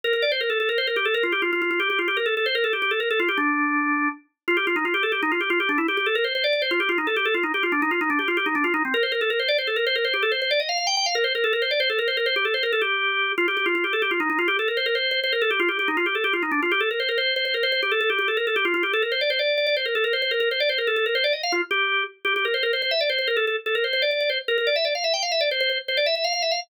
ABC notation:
X:1
M:6/8
L:1/16
Q:3/8=108
K:Dm
V:1 name="Drawbar Organ"
B B d c B A A B c B G A | B F G F F F F G G F G B | A A c B A G G A B A F G | D8 z4 |
[K:Gm] F G F E F G A G E F G F | G D =E G G A B c c d d c | F G F E A G A F E G F D | E F E D G F G E D F E C |
B c B A B c d c A B c B | c G A c c d e f f g g f | B c B A B c d c A B c B | c G A c B A G6 |
F G G F F G A G F E E F | G A B c B c2 c c B A G | F G G E F G A G F E D F | G A B c B c2 c c B c c |
G A A G G A B A G F F G | A B c d c d2 d d c B A | B c c B B c d c B A A B | c d e f F z G4 z2 |
[K:Dm] G G B c B c c e d c c B | A A z A B c c d d d c z | B B d e d f e g f e d c | c c z c d e e f f e f z |]